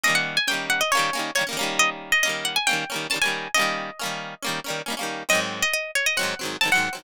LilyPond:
<<
  \new Staff \with { instrumentName = "Acoustic Guitar (steel)" } { \time 4/4 \key ees \major \tempo 4 = 137 ees''16 ges''8 aes''16 g''8 ges''16 ees''16 des''4 des''16 r8. | ees''16 r8 ees''16 ees''8 ges''16 aes''16 g''4 a''16 aes''8. | ees''2~ ees''8 r4. | ees''16 r8 ees''16 ees''8 des''16 ees''16 ges''4 a''16 ges''8. | }
  \new Staff \with { instrumentName = "Acoustic Guitar (steel)" } { \time 4/4 \key ees \major <ees g bes des'>4 <ees g bes des'>4 <ees g bes des'>8 <ees g bes des'>8 <ees g bes des'>16 <ees g bes des'>16 <ees g bes des'>8~ | <ees g bes des'>4 <ees g bes des'>4 <ees g bes des'>8 <ees g bes des'>8 <ees g bes des'>16 <ees g bes des'>8. | <ees g bes des'>4 <ees g bes des'>4 <ees g bes des'>8 <ees g bes des'>8 <ees g bes des'>16 <ees g bes des'>8. | <aes, ees ges c'>2 <aes, ees ges c'>8 <aes, ees ges c'>8 <aes, ees ges c'>16 <aes, ees ges c'>8 <aes, ees ges c'>16 | }
>>